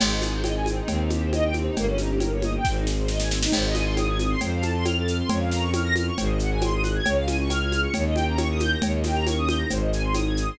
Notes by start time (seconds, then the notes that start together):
0.00 G#1 C4 D#4 G#4, crash, cowbell, low conga, shaker
0.10 D#4
0.22 G#4, snare, high conga, shaker
0.33 C5
0.43 D#5, cowbell, high conga, shaker
0.56 G#5
0.66 C4, high conga, shaker
0.78 D#4
0.88 D#2 C4 D#4 G4, cowbell, low conga, shaker
0.99 D#4
1.10 G4, high conga, shaker
1.22 C5
1.33 D#5, cowbell, high conga, shaker
1.44 G5
1.54 C4, high conga, shaker
1.66 D#4
1.76 G1 A#3 C#4 D#4 G4, cowbell, low conga, shaker
1.87 C#4
1.98 D#4, snare, high conga, shaker
2.09 G4
2.20 A#4, cowbell, high conga, shaker
2.32 C#5
2.42 D#5, high conga, shaker
2.56 G5
2.65 G#1 C4 D#4 G#4, kick, snare
2.75 D#4
2.85 G#4, snare
2.98 C5
3.08 D#5, snare
3.20 G#5, snare
3.30 C4, snare
3.41 D#4, snare
3.52 G#1 C4 D#4 G#4 C5, crash, cowbell, low conga, shaker
3.66 D#5
3.75 G#5, snare, high conga, shaker
3.85 C6
3.97 D#6, cowbell, high conga, shaker
4.08 G#6
4.18 D#6, high conga, shaker
4.30 C6
4.41 F2 C4 F4 A4 C5, cowbell, low conga, shaker
4.54 F5
4.61 A5, high conga, shaker
4.74 C6
4.85 F6, cowbell, high conga, shaker
4.98 A6
5.06 F6, shaker
5.20 C6
5.29 F2 C#4 F4 A#4 C#5, cowbell, low conga, shaker
5.40 F5
5.51 A#5, snare, shaker
5.61 C#6
5.73 F6, cowbell, high conga, shaker
5.84 A#6
5.95 F6, high conga, shaker
6.07 C#6
6.18 G#1 C4 D#4 F#4 G#4 C5, cowbell, low conga, shaker
6.27 D#5
6.39 F#5, shaker
6.51 G#5
6.61 C6, cowbell, high conga, shaker
6.73 D#6
6.83 F#6, high conga, shaker
6.95 G#6
7.06 C#2 C#4 F4 G#4 C#5, cowbell, low conga, shaker
7.16 F5
7.27 G#5, snare, high conga, shaker
7.41 C#6
7.50 F6, cowbell, high conga, shaker
7.62 G#6
7.70 F6, high conga, shaker
7.82 C#6
7.93 D#2 C#4 D#4 G4 A#4 C#5, cowbell, low conga, shaker
8.06 D#5
8.15 G5, high conga, shaker
8.27 A#5
8.37 C#6, cowbell, high conga, shaker
8.50 D#6
8.60 G6, high conga, shaker
8.71 A#6
8.82 D#2 C#4 D#4 G4 A#4 C#5, cowbell, low conga, shaker
8.95 D#5
9.04 G5, snare, high conga, shaker
9.14 A#5
9.27 C#6, cowbell, high conga, shaker
9.37 D#6
9.48 G6, high conga, shaker
9.58 A#6
9.69 G#1 C4 D#4 G#4 C5, cowbell, low conga, shaker
9.80 D#5
9.92 G#5, shaker
10.04 C6
10.14 D#6, cowbell, high conga, shaker
10.27 G#6
10.37 D#6, shaker
10.48 C6